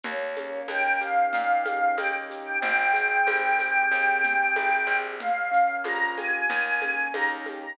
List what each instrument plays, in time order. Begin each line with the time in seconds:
0.03 electric bass (finger) D#2, acoustic grand piano A#3, choir aahs C#5, low conga, shaker
0.36 acoustic grand piano C#4, high conga, shaker
0.68 electric bass (finger) D#2, acoustic grand piano D#4, choir aahs G5, tambourine, high conga, shaker
1.01 acoustic grand piano G4, choir aahs F5, shaker
1.33 electric bass (finger) A#2, acoustic grand piano A#3, low conga, shaker
1.65 acoustic grand piano C#4, high conga, shaker
1.97 electric bass (finger) D#2, acoustic grand piano D#4, choir aahs G5, tambourine, high conga, shaker
2.30 acoustic grand piano G4, shaker
2.46 choir aahs G5
2.61 electric bass (finger) G#1, acoustic grand piano C4, choir aahs G5, low conga, shaker
2.93 acoustic grand piano G#4, shaker
3.27 electric bass (finger) G#1, acoustic grand piano C4, tambourine, high conga, shaker
3.58 acoustic grand piano G4, high conga, shaker
3.91 electric bass (finger) D#2, acoustic grand piano C4, shaker
4.23 acoustic grand piano G#4, low conga, shaker
4.55 electric bass (finger) G#1, acoustic grand piano G4, tambourine, high conga, shaker
4.87 electric bass (finger) A#1, acoustic grand piano C4
5.20 acoustic grand piano A#3, choir aahs F5, low conga, shaker
5.51 acoustic grand piano C#4, shaker
5.84 electric bass (finger) A#1, acoustic grand piano F4, choir aahs A#5, tambourine, high conga, shaker
6.17 acoustic grand piano G4, choir aahs G#5, high conga, shaker
6.49 electric bass (finger) D#2, acoustic grand piano A#3, low conga, shaker
6.81 acoustic grand piano C#4, high conga, shaker
7.14 electric bass (finger) D#2, acoustic grand piano D#4, choir aahs A#5, tambourine, high conga, shaker
7.46 acoustic grand piano G4, high conga, shaker
7.62 choir aahs A#5